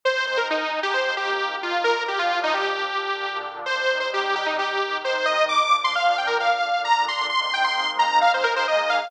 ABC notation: X:1
M:4/4
L:1/16
Q:1/4=132
K:Cm
V:1 name="Lead 2 (sawtooth)"
c2 c B E3 G c2 G4 F2 | B2 G F2 E G8 z2 | c3 c G2 G E G4 c2 e2 | d'3 c' f2 g B f4 b2 c'2 |
c' c' g c'3 b2 f c B c e2 f2 |]
V:2 name="Pad 5 (bowed)"
[A,CE]4 [A,EA]4 [F,B,CE]4 [F,B,EF]4 | [B,,F,D]8 [B,,D,D]8 | [C,G,E]8 [C,E,E]8 | [B,,F,D]8 [B,,D,D]8 |
[A,B,CE]8 [A,B,EA]8 |]